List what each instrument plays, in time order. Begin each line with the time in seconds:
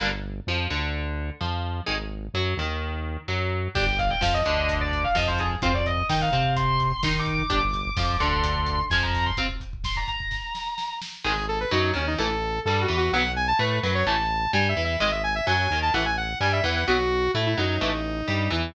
0.00 synth bass 1 G1, overdriven guitar D3 G3 A#3
0.47 synth bass 1 F2, overdriven guitar F3
0.70 synth bass 1 D2, overdriven guitar D3
1.41 synth bass 1 F2, overdriven guitar F3
1.86 synth bass 1 G#1, overdriven guitar D#3 G#3
2.34 synth bass 1 F#2, overdriven guitar F#3
2.57 synth bass 1 D#2, overdriven guitar D#3
3.28 synth bass 1 F#2, overdriven guitar F#3
3.75 synth bass 1 G1, overdriven guitar D4 G4, distortion guitar G5, kick, crash
3.87 kick
3.98 distortion guitar F5, kick, closed hi-hat
4.10 distortion guitar G5, kick
4.21 synth bass 1 F2, overdriven guitar F3, distortion guitar F5, kick, snare
4.34 distortion guitar D#5, kick
4.45 synth bass 1 D2, overdriven guitar D3, kick, closed hi-hat
4.57 kick
4.69 kick, closed hi-hat
4.81 distortion guitar D5, kick
4.92 kick, closed hi-hat
5.04 distortion guitar F5, kick
5.15 synth bass 1 F2, overdriven guitar F3, distortion guitar D#5, kick, snare
5.27 distortion guitar C5, kick
5.38 distortion guitar G#4, kick, closed hi-hat
5.51 kick
5.62 synth bass 1 F2, overdriven guitar C4 F4, distortion guitar C5, kick, closed hi-hat
5.74 distortion guitar D5, kick
5.86 distortion guitar D#5, kick, closed hi-hat
5.97 kick
6.09 synth bass 1 D#3, overdriven guitar D#4, distortion guitar G5, kick, snare
6.21 distortion guitar F5, kick
6.32 synth bass 1 C3, overdriven guitar C4, kick, closed hi-hat
6.44 kick
6.56 distortion guitar C6, kick, closed hi-hat
6.69 kick
6.80 kick, closed hi-hat
6.90 kick
7.03 synth bass 1 D#3, overdriven guitar D#4, distortion guitar C6, kick, snare
7.15 kick
7.19 distortion guitar D6
7.26 kick, closed hi-hat
7.34 distortion guitar D6
7.39 kick
7.50 synth bass 1 G1, overdriven guitar D4 G4, distortion guitar D6, kick, closed hi-hat
7.62 kick
7.73 kick, closed hi-hat
7.85 kick
7.97 synth bass 1 F2, overdriven guitar F3, kick, snare
8.09 kick
8.20 synth bass 1 D2, overdriven guitar D3, distortion guitar C6, kick, closed hi-hat
8.32 distortion guitar C6, kick
8.44 kick, closed hi-hat
8.55 kick
8.66 kick, closed hi-hat
8.78 kick
8.90 synth bass 1 F2, overdriven guitar F3, distortion guitar G#5, kick, snare
9.02 distortion guitar A#5, kick
9.14 kick, open hi-hat
9.26 distortion guitar C6, kick
9.37 overdriven guitar C4 F4, kick, closed hi-hat
9.49 kick
9.60 kick, closed hi-hat
9.73 kick
9.84 distortion guitar C6, kick, snare
9.96 distortion guitar A#5, kick
10.08 distortion guitar A#5, kick, closed hi-hat
10.20 kick
10.31 kick, snare
10.55 snare
10.78 snare
11.02 snare
11.24 synth bass 1 G#1, overdriven guitar D#3 G#3, lead 2 (sawtooth) G#4
11.48 lead 2 (sawtooth) A4
11.60 lead 2 (sawtooth) B4
11.71 synth bass 1 F#2, overdriven guitar F#3, lead 2 (sawtooth) D#4
11.94 synth bass 1 D#2, overdriven guitar D#3, lead 2 (sawtooth) C#4
12.07 lead 2 (sawtooth) D#4
12.18 synth bass 1 A1, overdriven guitar E3 A3, lead 2 (sawtooth) A4
12.65 synth bass 1 G2, overdriven guitar G3, lead 2 (sawtooth) A4
12.81 lead 2 (sawtooth) F#4
12.88 synth bass 1 E2, overdriven guitar E3
12.97 lead 2 (sawtooth) F#4
13.12 synth bass 1 B1, overdriven guitar F#3 B3, lead 2 (sawtooth) F#5
13.36 lead 2 (sawtooth) G#5
13.48 lead 2 (sawtooth) A5
13.59 synth bass 1 A2, overdriven guitar A3, lead 2 (sawtooth) B4
13.83 synth bass 1 F#2, overdriven guitar F#3, lead 2 (sawtooth) B4
13.95 lead 2 (sawtooth) C#5
14.06 synth bass 1 A1, overdriven guitar E3 A3, lead 2 (sawtooth) A5
14.53 synth bass 1 G2, overdriven guitar G3, lead 2 (sawtooth) G#5
14.69 lead 2 (sawtooth) E5
14.76 synth bass 1 E2, overdriven guitar E3
14.84 lead 2 (sawtooth) E5
15.00 synth bass 1 G#1, overdriven guitar D#3 G#3, lead 2 (sawtooth) D#5
15.12 lead 2 (sawtooth) E5
15.24 lead 2 (sawtooth) G#5
15.35 lead 2 (sawtooth) E5
15.47 synth bass 1 F#2, overdriven guitar F#3, lead 2 (sawtooth) G#5
15.70 synth bass 1 D#2, overdriven guitar D#3
15.82 lead 2 (sawtooth) A5
15.94 synth bass 1 A1, overdriven guitar E3 A3, lead 2 (sawtooth) F#5
16.05 lead 2 (sawtooth) G#5
16.17 lead 2 (sawtooth) F#5
16.40 synth bass 1 G2, overdriven guitar G3, lead 2 (sawtooth) G#5
16.52 lead 2 (sawtooth) E5
16.64 synth bass 1 E2, overdriven guitar E3, lead 2 (sawtooth) F#5
16.76 lead 2 (sawtooth) F#5
16.88 synth bass 1 B1, overdriven guitar F#3 B3, lead 2 (sawtooth) F#4
17.34 synth bass 1 A2, overdriven guitar A3, lead 2 (sawtooth) E4
17.46 lead 2 (sawtooth) E4
17.58 synth bass 1 F#2, overdriven guitar F#3, lead 2 (sawtooth) D#4
17.81 synth bass 1 A1, overdriven guitar E3 A3
18.28 synth bass 1 G2, overdriven guitar G3
18.50 synth bass 1 E2, overdriven guitar E3